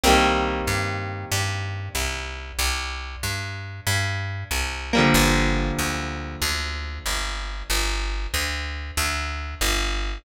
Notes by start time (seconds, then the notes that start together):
0.03 C2 G3 A#3 C4
0.09 D#3
0.67 G2
1.32 G2
1.95 C2
2.59 C2
3.23 G2
3.87 G2
4.51 C2
4.93 F3 G3 A#3
4.98 D3
5.14 G1
5.79 D2
6.42 D2
7.06 G1
7.70 G1
8.34 D2
8.97 D2
9.61 G1